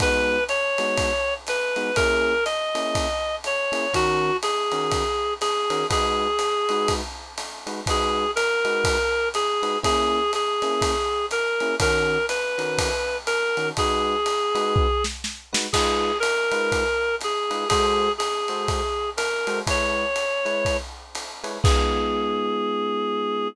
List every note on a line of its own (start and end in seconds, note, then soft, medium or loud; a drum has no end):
0.00 0.37 G#3 medium
0.00 0.37 B3 medium
0.00 0.37 D#4 medium
0.00 0.37 F#4 medium
0.00 0.44 B4 loud
0.00 kick medium
0.00 ride loud
0.49 1.34 C#5 loud
0.49 hi-hat pedal medium
0.49 ride medium
0.78 1.10 G#3 medium
0.78 1.10 B3 medium
0.78 1.10 D#4 medium
0.78 1.10 F#4 medium
0.78 ride medium
0.97 kick medium
0.97 ride loud
1.47 1.96 B4 loud
1.47 hi-hat pedal medium
1.47 ride medium
1.76 1.90 G#3 medium
1.76 1.90 B3 medium
1.76 1.90 D#4 medium
1.76 1.90 F#4 medium
1.76 ride medium
1.96 2.34 A#3 medium
1.96 2.34 C#4 medium
1.96 2.34 E4 medium
1.96 2.34 G#4 loud
1.96 2.44 A#4 loud
1.96 kick medium
1.96 ride loud
2.45 3.36 D#5 medium
2.45 hi-hat pedal medium
2.45 ride medium
2.75 3.07 A#3 medium
2.75 3.07 C#4 medium
2.75 3.07 E4 medium
2.75 3.07 G#4 medium
2.75 ride medium
2.95 kick medium
2.95 ride loud
3.44 3.94 C#5 loud
3.44 hi-hat pedal medium
3.44 ride medium
3.72 3.86 A#3 medium
3.72 3.86 C#4 medium
3.72 3.86 E4 medium
3.72 3.86 G#4 medium
3.72 ride medium
3.93 4.31 D#3 loud
3.93 4.31 C#4 loud
3.93 4.31 F#4 medium
3.93 4.37 F#4 loud
3.93 4.31 A#4 loud
3.93 kick medium
3.93 ride loud
4.43 5.34 G#4 loud
4.43 hi-hat pedal medium
4.43 ride medium
4.72 5.03 D#3 medium
4.72 5.03 C#4 medium
4.72 5.03 F#4 medium
4.72 5.03 A#4 medium
4.72 ride medium
4.91 kick medium
4.91 ride loud
5.41 5.86 G#4 loud
5.41 hi-hat pedal medium
5.41 ride medium
5.70 5.84 D#3 medium
5.70 5.84 C#4 medium
5.70 5.84 F#4 medium
5.70 5.84 A#4 medium
5.70 ride medium
5.90 6.27 G#3 medium
5.90 6.27 D#4 medium
5.90 6.27 F#4 medium
5.90 6.94 G#4 loud
5.90 6.27 B4 medium
5.90 kick medium
5.90 ride loud
6.39 hi-hat pedal medium
6.39 ride medium
6.69 7.01 G#3 medium
6.69 7.01 D#4 medium
6.69 7.01 F#4 medium
6.69 7.01 B4 medium
6.69 ride medium
6.88 kick medium
6.88 ride loud
7.37 hi-hat pedal medium
7.37 ride medium
7.67 7.81 G#3 medium
7.67 7.81 D#4 medium
7.67 7.81 F#4 medium
7.67 7.81 B4 medium
7.67 ride medium
7.86 8.25 G#3 medium
7.86 8.25 D#4 medium
7.86 8.25 F#4 medium
7.86 8.31 G#4 loud
7.86 8.25 B4 medium
7.86 kick medium
7.86 ride loud
8.36 9.29 A#4 loud
8.36 hi-hat pedal medium
8.36 ride medium
8.65 8.97 G#3 medium
8.65 8.97 D#4 medium
8.65 8.97 F#4 medium
8.65 8.97 B4 medium
8.65 ride medium
8.84 kick medium
8.84 ride loud
9.34 9.78 G#4 loud
9.34 hi-hat pedal medium
9.34 ride medium
9.62 9.77 G#3 medium
9.62 9.77 D#4 medium
9.62 9.77 F#4 medium
9.62 9.77 B4 medium
9.62 ride medium
9.83 10.20 A#3 medium
9.83 10.20 C#4 medium
9.83 10.20 E4 loud
9.83 10.20 G#4 medium
9.83 10.32 G#4 loud
9.83 kick medium
9.83 ride loud
10.33 11.26 G#4 loud
10.33 hi-hat pedal medium
10.33 ride medium
10.62 10.94 A#3 medium
10.62 10.94 C#4 medium
10.62 10.94 E4 medium
10.62 10.94 G#4 medium
10.62 ride medium
10.82 kick medium
10.82 ride loud
11.31 11.76 A#4 loud
11.31 hi-hat pedal medium
11.31 ride medium
11.60 11.75 A#3 medium
11.60 11.75 C#4 medium
11.60 11.75 E4 medium
11.60 11.75 G#4 medium
11.60 ride medium
11.80 12.17 D#3 loud
11.80 12.17 C#4 loud
11.80 12.17 F#4 medium
11.80 12.17 A#4 loud
11.80 12.26 A#4 loud
11.80 kick medium
11.80 ride loud
12.29 13.17 B4 medium
12.29 hi-hat pedal medium
12.29 ride medium
12.58 12.90 D#3 medium
12.58 12.90 C#4 medium
12.58 12.90 F#4 medium
12.58 12.90 A#4 medium
12.58 ride medium
12.78 kick medium
12.78 ride loud
13.27 13.69 A#4 loud
13.27 hi-hat pedal medium
13.27 ride medium
13.57 13.71 D#3 medium
13.57 13.71 C#4 medium
13.57 13.71 F#4 medium
13.57 13.71 A#4 medium
13.57 ride medium
13.77 14.15 G#3 medium
13.77 14.15 D#4 medium
13.77 14.15 F#4 loud
13.77 15.04 G#4 loud
13.77 14.15 B4 medium
13.77 kick medium
13.77 ride loud
14.26 hi-hat pedal medium
14.26 ride medium
14.55 14.87 G#3 medium
14.55 14.87 D#4 medium
14.55 14.87 F#4 medium
14.55 14.87 B4 medium
14.55 ride medium
14.76 kick loud
15.04 snare medium
15.24 snare medium
15.53 15.67 G#3 medium
15.53 15.67 D#4 medium
15.53 15.67 F#4 medium
15.53 15.67 B4 medium
15.53 snare loud
15.73 16.11 G#3 medium
15.73 16.11 D#4 medium
15.73 16.11 F4 loud
15.73 16.18 G#4 loud
15.73 16.11 B4 medium
15.73 kick medium
15.73 crash loud
15.73 ride loud
16.20 17.16 A#4 loud
16.20 hi-hat pedal medium
16.20 ride medium
16.51 16.84 G#3 medium
16.51 16.84 D#4 medium
16.51 16.84 F4 medium
16.51 16.84 B4 medium
16.51 ride medium
16.72 kick medium
16.72 ride medium
17.21 17.68 G#4 loud
17.21 hi-hat pedal medium
17.21 ride medium
17.51 17.65 G#3 medium
17.51 17.65 D#4 medium
17.51 17.65 F4 medium
17.51 17.65 B4 medium
17.51 ride medium
17.69 18.09 G#3 loud
17.69 18.09 F#4 medium
17.69 18.12 G#4 loud
17.69 18.09 A4 medium
17.69 18.09 C5 loud
17.69 kick medium
17.69 ride loud
18.18 19.10 G#4 medium
18.18 hi-hat pedal medium
18.18 ride medium
18.48 18.81 G#3 medium
18.48 18.81 F#4 medium
18.48 18.81 A4 medium
18.48 18.81 C5 medium
18.48 ride medium
18.68 kick medium
18.68 ride medium
19.17 19.59 A#4 medium
19.17 hi-hat pedal medium
19.17 ride loud
19.47 19.61 G#3 medium
19.47 19.61 F#4 medium
19.47 19.61 A4 medium
19.47 19.61 C5 medium
19.47 ride medium
19.67 20.05 G#3 medium
19.67 20.05 E4 medium
19.67 20.05 B4 medium
19.67 20.05 C#5 medium
19.67 20.77 C#5 loud
19.67 kick medium
19.67 ride loud
20.16 hi-hat pedal medium
20.16 ride medium
20.45 20.77 G#3 medium
20.45 20.77 E4 medium
20.45 20.77 B4 medium
20.45 20.77 C#5 medium
20.45 ride medium
20.65 kick medium
20.65 ride medium
21.15 hi-hat pedal medium
21.15 ride medium
21.44 21.58 G#3 medium
21.44 21.58 E4 medium
21.44 21.58 B4 medium
21.44 21.58 C#5 medium
21.44 ride medium
21.64 23.48 G#3 loud
21.64 23.48 B3 loud
21.64 23.48 D#4 medium
21.64 23.48 F4 medium
21.64 23.48 G#4 loud
21.64 kick loud
21.64 crash loud